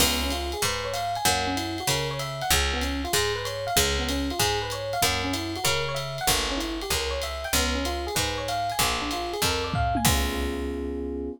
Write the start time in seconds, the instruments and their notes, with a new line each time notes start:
0.00 electric bass (finger) C#2, electric piano 1 B3, kick, crash, ride
0.23 electric piano 1 C#4
0.30 electric piano 1 F4, hi-hat pedal, ride
0.52 electric piano 1 G#4, ride
0.62 electric bass (finger) G#2, electric piano 1 B4, kick, ride
0.84 electric piano 1 C#5
0.93 electric piano 1 F5, hi-hat pedal, ride
1.15 electric piano 1 G#5, ride
1.25 electric bass (finger) F#2, electric piano 1 A#3, kick, ride
1.47 electric piano 1 C#4
1.57 electric piano 1 E4, hi-hat pedal, ride
1.78 electric piano 1 F#4, ride
1.87 electric bass (finger) C#3, electric piano 1 A#4, kick, ride
2.11 electric piano 1 C#5
2.19 electric piano 1 E5, hi-hat pedal, ride
2.41 electric piano 1 F#5, ride
2.50 electric bass (finger) C#2, electric piano 1 G#3, kick, ride
2.73 electric piano 1 B3
2.81 electric piano 1 C#4, hi-hat pedal, ride
3.04 electric piano 1 F4, ride
3.13 electric bass (finger) G#2, electric piano 1 G#4, kick, ride
3.36 electric piano 1 B4
3.45 electric piano 1 C#5, hi-hat pedal, ride
3.67 electric piano 1 F5, ride
3.76 electric bass (finger) C#2, electric piano 1 G#3, kick, ride
3.99 electric piano 1 B3
4.09 electric piano 1 C#4, hi-hat pedal, ride
4.30 electric piano 1 F4, ride
4.39 electric bass (finger) G#2, electric piano 1 G#4, kick, ride
4.62 electric piano 1 B4
4.70 electric piano 1 C#5, hi-hat pedal, ride
4.93 electric piano 1 F5, ride
5.02 electric bass (finger) F#2, electric piano 1 A#3, kick, ride
5.24 electric piano 1 C#4
5.33 electric piano 1 E4, hi-hat pedal, ride
5.56 electric piano 1 F#4, ride
5.64 electric bass (finger) C#3, electric piano 1 A#4, kick, ride
5.88 electric piano 1 C#5
5.95 electric piano 1 E5, hi-hat pedal, ride
6.18 electric piano 1 F#5, ride
6.27 electric bass (finger) G1, electric piano 1 A#3, kick, ride
6.49 electric piano 1 C#4
6.57 electric piano 1 E4, hi-hat pedal, ride
6.81 electric piano 1 G4, ride
6.90 electric bass (finger) C#2, electric piano 1 A#4, kick, ride
7.11 electric piano 1 C#5
7.22 electric piano 1 E5, hi-hat pedal, ride
7.44 electric piano 1 G5, ride
7.53 electric bass (finger) C#2, electric piano 1 B3, kick, ride
7.75 electric piano 1 C#4
7.85 electric piano 1 F4, hi-hat pedal, ride
8.07 electric piano 1 G#4, ride
8.15 electric bass (finger) G#2, electric piano 1 B4, kick, ride
8.38 electric piano 1 C#5
8.48 electric piano 1 F5, hi-hat pedal, ride
8.70 electric piano 1 G#5, ride
8.79 electric bass (finger) A#1, electric piano 1 A#3, kick, ride
9.02 electric piano 1 D4
9.11 electric piano 1 F4, hi-hat pedal, ride
9.33 electric piano 1 G#4, ride
9.42 electric bass (finger) F2, electric piano 1 A#4, kick, ride
9.64 electric piano 1 D5
9.74 electric piano 1 F5, kick, floor tom
9.95 electric piano 1 G#5, high tom
10.05 electric bass (finger) C#2, electric piano 1 B3 C#4 F4 G#4, kick, crash